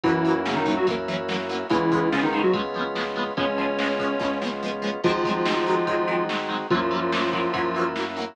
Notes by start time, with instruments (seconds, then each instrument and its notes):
0.03 synth bass 1 F#2, lead 1 (square) E3 E4, acoustic guitar (steel) E3 F#3, drawbar organ A#3 C#4 E4 F#4, kick, ride
0.08 acoustic guitar (steel) A#3 C#4
0.25 acoustic guitar (steel) E3 F#3 A#3, ride
0.30 acoustic guitar (steel) C#4
0.45 lead 1 (square) C#3 C#4, acoustic guitar (steel) E3 F#3 A#3, snare
0.51 acoustic guitar (steel) C#4
0.56 lead 1 (square) D#3 D#4
0.66 acoustic guitar (steel) E3 F#3 A#3, kick, ride
0.71 acoustic guitar (steel) C#4
0.77 lead 1 (square) F#3 F#4
0.87 synth bass 1 F#2, acoustic guitar (steel) E3 F#3 A#3, kick, ride
0.92 acoustic guitar (steel) C#4
1.08 acoustic guitar (steel) E3 F#3 A#3, ride
1.13 acoustic guitar (steel) C#4
1.28 acoustic guitar (steel) E3 F#3 A#3, snare
1.34 acoustic guitar (steel) C#4
1.49 acoustic guitar (steel) E3 F#3 A#3, ride
1.55 acoustic guitar (steel) C#4
1.69 synth bass 1 C#2, lead 1 (square) E3 E4, acoustic guitar (steel) F3 G#3 B3, drawbar organ G#3 B3 C#4 F4, kick, ride
1.75 acoustic guitar (steel) C#4
1.92 acoustic guitar (steel) F3 G#3 B3, kick, ride
1.97 acoustic guitar (steel) C#4
2.12 lead 1 (square) C#3 C#4, acoustic guitar (steel) F3 G#3 B3, snare
2.17 acoustic guitar (steel) C#4
2.23 lead 1 (square) D#3 D#4
2.33 acoustic guitar (steel) F3 G#3, ride
2.37 acoustic guitar (steel) B3 C#4
2.43 lead 1 (square) F#3 F#4
2.54 synth bass 1 C#2, acoustic guitar (steel) F3 G#3 B3, kick, ride
2.59 acoustic guitar (steel) C#4
2.74 acoustic guitar (steel) F3 G#3, ride
2.79 acoustic guitar (steel) B3 C#4
2.95 acoustic guitar (steel) F3 G#3 B3, snare
3.00 acoustic guitar (steel) C#4
3.16 acoustic guitar (steel) F3 G#3 B3, ride
3.21 acoustic guitar (steel) C#4
3.37 synth bass 1 C#2, acoustic guitar (steel) F3 G#3 B3, drawbar organ G#3 B3 C#4 F4, lead 1 (square) C#4 C#5, kick, ride
3.43 acoustic guitar (steel) C#4
3.58 acoustic guitar (steel) F3 G#3 B3, ride
3.63 acoustic guitar (steel) C#4
3.79 acoustic guitar (steel) F3 G#3, snare
3.83 acoustic guitar (steel) B3 C#4
3.99 acoustic guitar (steel) F3 G#3 B3, kick, ride
4.04 acoustic guitar (steel) C#4
4.19 synth bass 1 C#2, acoustic guitar (steel) F3 G#3 B3, kick, snare
4.24 acoustic guitar (steel) C#4
4.42 acoustic guitar (steel) F3 G#3 B3, snare
4.47 acoustic guitar (steel) C#4
4.63 acoustic guitar (steel) F3 G#3 B3
4.68 acoustic guitar (steel) C#4
4.82 acoustic guitar (steel) F3 G#3 B3
4.87 acoustic guitar (steel) C#4
5.04 synth bass 1 G#1, acoustic guitar (steel) D#3 F#3 G#3, lead 1 (square) F3 F4, drawbar organ G#3 C4 D#4 F#4, kick, crash
5.09 acoustic guitar (steel) C4
5.24 acoustic guitar (steel) D#3 F#3 G#3, kick, ride
5.30 acoustic guitar (steel) C4
5.45 acoustic guitar (steel) D#3 F#3, snare
5.50 acoustic guitar (steel) G#3 C4
5.66 acoustic guitar (steel) D#3 F#3 G#3, ride
5.72 acoustic guitar (steel) C4
5.87 synth bass 1 G#1, acoustic guitar (steel) D#3 F#3 G#3, kick, ride
5.92 acoustic guitar (steel) C4
6.07 acoustic guitar (steel) D#3 F#3 G#3, ride
6.13 acoustic guitar (steel) C4
6.29 acoustic guitar (steel) D#3 F#3 G#3, snare
6.35 acoustic guitar (steel) C4
6.49 acoustic guitar (steel) D#3 F#3 G#3, ride
6.54 acoustic guitar (steel) C4
6.70 synth bass 1 F#2, acoustic guitar (steel) E3 F#3, lead 1 (square) F3 F4, drawbar organ A#3 C#4 E4 F#4, kick, ride
6.75 acoustic guitar (steel) A#3 C#4
6.91 acoustic guitar (steel) E3 F#3 A#3, ride
6.96 acoustic guitar (steel) C#4
7.12 acoustic guitar (steel) E3 F#3, snare
7.17 acoustic guitar (steel) A#3 C#4
7.33 acoustic guitar (steel) E3 F#3 A#3, kick, ride
7.38 acoustic guitar (steel) C#4
7.53 synth bass 1 F#2, acoustic guitar (steel) E3 F#3 A#3, kick, ride
7.58 acoustic guitar (steel) C#4
7.75 acoustic guitar (steel) E3 F#3, ride
7.79 acoustic guitar (steel) A#3 C#4
7.96 acoustic guitar (steel) E3 F#3, snare
8.00 acoustic guitar (steel) A#3 C#4
8.16 acoustic guitar (steel) E3 F#3, ride
8.20 acoustic guitar (steel) A#3 C#4